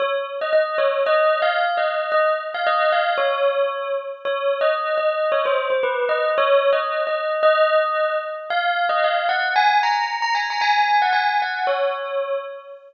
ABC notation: X:1
M:2/4
L:1/16
Q:1/4=113
K:Db
V:1 name="Tubular Bells"
d z2 e e2 d2 | (3e4 f4 e4 | e z2 f e2 f2 | d6 z2 |
(3d4 e4 e4 | d c2 c =B2 e2 | (3^c4 e4 e4 | e6 z2 |
f3 e f2 g2 | a2 b3 b a b | a3 g a2 g2 | d6 z2 |]